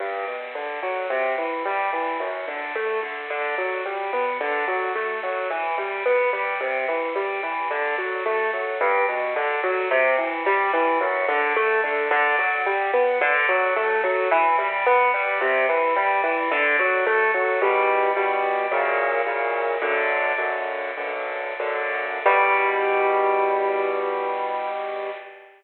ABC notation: X:1
M:4/4
L:1/8
Q:1/4=109
K:G
V:1 name="Acoustic Grand Piano"
G,, B,, D, F, C, E, G, E, | F,, D, A, D, D, F, G, B, | D, F, A, F, E, G, B, G, | C, E, G, E, D, F, A, F, |
G,, B,, D, F, C, E, G, E, | F,, D, A, D, D, F, G, B, | D, F, A, F, E, G, B, G, | C, E, G, E, D, F, A, F, |
[K:Em] [E,,B,,G,]2 [E,,B,,G,]2 [F,,^A,,^C,]2 [F,,A,,C,]2 | "^rit." [B,,,F,,D,]2 [B,,,F,,D,]2 [B,,,F,,D,]2 [B,,,F,,D,]2 | [E,,B,,G,]8 |]